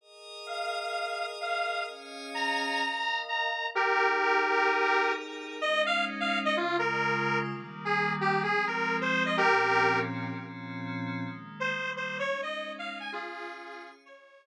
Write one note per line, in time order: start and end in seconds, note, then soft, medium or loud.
0.01 1.86 G#4 medium
0.01 1.86 A#4 medium
0.01 1.86 D#5 medium
0.46 1.26 F5 medium
1.41 1.83 F5 medium
1.87 2.80 C#4 medium
1.87 2.80 G#4 medium
1.87 2.80 D#5 medium
1.87 2.80 F5 medium
2.34 3.20 A#5 medium
2.82 3.73 A#4 medium
2.82 3.75 D#5 medium
2.82 3.75 F5 medium
3.28 3.67 A#5 medium
3.74 5.60 D#4 medium
3.74 5.12 G4 medium
3.74 5.60 G#4 medium
3.74 5.60 A#4 medium
3.74 5.12 A#4 medium
5.61 6.55 G#3 medium
5.61 6.55 C#4 medium
5.61 6.55 D#4 medium
5.61 5.82 D#5 medium
5.86 6.05 F5 medium
6.20 6.39 F5 medium
6.45 6.56 D#5 medium
6.57 7.50 C#3 medium
6.57 7.50 G#3 medium
6.57 6.77 F4 medium
6.57 7.50 F4 medium
6.79 7.39 A#4 medium
7.49 8.42 D#3 loud
7.49 8.42 G3 medium
7.49 8.42 A#3 medium
7.85 8.13 G#4 medium
8.21 8.42 G4 medium
8.43 9.37 F3 medium
8.43 9.37 G#3 medium
8.43 9.37 C4 medium
8.43 8.65 G#4 medium
8.67 8.97 A#4 medium
9.01 9.24 C5 medium
9.26 9.37 D#5 medium
9.37 10.31 A#2 medium
9.37 10.31 F3 medium
9.37 10.31 C4 medium
9.37 10.31 C#4 medium
9.37 9.99 G4 medium
9.37 9.99 A#4 medium
10.31 11.24 A#2 medium
10.31 11.24 F3 medium
10.31 11.24 C4 medium
10.31 11.24 C#4 medium
11.25 11.71 D#3 medium
11.25 11.71 G#3 medium
11.25 11.71 A#3 medium
11.60 11.91 C5 medium
11.72 12.19 D#3 medium
11.72 12.19 G3 loud
11.72 12.19 A#3 medium
11.96 12.17 C5 medium
12.19 13.12 G#3 medium
12.19 13.11 C#4 medium
12.19 13.12 D#4 medium
12.19 12.41 C#5 medium
12.42 12.73 D#5 medium
12.79 12.99 F5 medium
13.00 13.11 G#5 medium
13.11 14.04 C#4 medium
13.11 13.91 F4 medium
13.11 14.04 G#4 medium
13.11 13.91 G#4 medium
13.11 14.04 F5 medium
14.05 14.46 G#4 medium
14.05 14.46 C#5 medium
14.05 14.46 D#5 medium